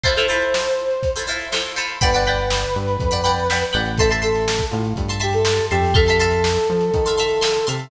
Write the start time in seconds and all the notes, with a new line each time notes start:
0.03 E4 F4 A4 C5, kick, closed hi-hat
0.16 E4 F4 A4 C5, closed hi-hat
0.28 E4 F4 A4 C5, closed hi-hat
0.42 closed hi-hat
0.54 snare
0.66 closed hi-hat
0.78 closed hi-hat
0.91 closed hi-hat
1.03 kick, closed hi-hat
1.16 E4 F4 A4 C5, closed hi-hat
1.27 E4 F4 A4 C5, closed hi-hat
1.40 snare, closed hi-hat
1.52 E4 F4 A4 C5, snare
1.65 closed hi-hat
1.76 E4 F4 A4 C5, closed hi-hat
1.89 closed hi-hat
2.01 G1 B4 D5 F#5 G5 B5, kick, closed hi-hat
2.13 D5 F#5 G5 B5, closed hi-hat
2.26 D5 F#5 G5 B5, closed hi-hat
2.39 closed hi-hat
2.50 snare
2.62 closed hi-hat
2.75 G2, closed hi-hat
2.88 closed hi-hat
3.00 F2, kick, closed hi-hat
3.11 D5 F#5 G5 B5, closed hi-hat
3.24 D5 F#5 G5 B5, closed hi-hat
3.37 closed hi-hat
3.50 D5 F#5 G5 B5, snare
3.61 closed hi-hat
3.73 A1 D5 F#5 G5 B5, closed hi-hat
3.86 closed hi-hat
3.97 A4 E5 A5 C6, kick, closed hi-hat
4.10 E5 A5 C6, closed hi-hat
4.22 A4 E5 A5 C6, closed hi-hat
4.35 snare, closed hi-hat
4.48 snare
4.59 kick, closed hi-hat
4.71 A2 F4, closed hi-hat
4.85 closed hi-hat
4.96 G2, kick, closed hi-hat
5.08 E5 A5 C6, closed hi-hat
5.20 G4 E5 A5 C6, closed hi-hat
5.33 A4, closed hi-hat
5.45 E5 A5 C6, snare
5.58 closed hi-hat
5.71 F2 G4 E5 A5 C6, closed hi-hat
5.83 open hi-hat
5.94 A4 E5 F5 A5 C6, kick, closed hi-hat
6.06 E5 F5 A5 C6, snare, closed hi-hat
6.19 E5 F5 A5 C6, closed hi-hat
6.31 closed hi-hat
6.44 snare
6.56 closed hi-hat
6.67 F3, closed hi-hat
6.81 snare, closed hi-hat
6.94 D#3, kick, closed hi-hat
7.05 E5 F5 A5 C6, snare, closed hi-hat
7.18 E5 F5 A5 C6, closed hi-hat
7.29 closed hi-hat
7.41 E5 F5 A5 C6, snare
7.54 closed hi-hat
7.67 C3 E5 F5 A5 C6, closed hi-hat
7.79 closed hi-hat